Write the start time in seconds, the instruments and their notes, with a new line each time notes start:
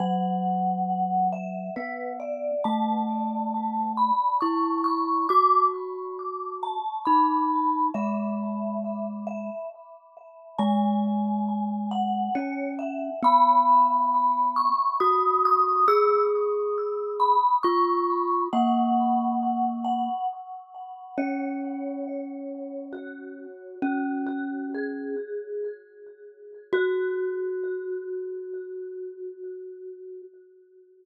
0.00 glockenspiel F#3, vibraphone F#5
1.33 vibraphone E5
1.76 glockenspiel B3, vibraphone B4
2.20 vibraphone D5
2.64 glockenspiel A3, vibraphone A5
3.97 vibraphone B5
4.41 glockenspiel E4, vibraphone C#6
4.84 vibraphone C#6
5.29 glockenspiel F#4, vibraphone D6
6.63 vibraphone A5
7.05 glockenspiel D#4, vibraphone B5
7.94 glockenspiel G#3, vibraphone E5
9.27 vibraphone E5
10.58 glockenspiel G#3, vibraphone G#5
11.91 vibraphone F#5
12.35 glockenspiel C#4, vibraphone C#5
12.79 vibraphone E5
13.23 glockenspiel B3, vibraphone B5
14.56 vibraphone C#6
15.00 glockenspiel F#4, vibraphone D#6
15.45 vibraphone D#6
15.88 glockenspiel G#4, vibraphone E6
17.20 vibraphone B5
17.63 glockenspiel F4, vibraphone C#6
18.53 glockenspiel A#3, vibraphone F#5
19.85 vibraphone F#5
21.18 glockenspiel C#4, vibraphone C#5
22.93 vibraphone F#4
23.82 glockenspiel C#4, vibraphone F#4
24.26 vibraphone F#4
24.74 vibraphone G#4
26.73 glockenspiel F#4, vibraphone F#4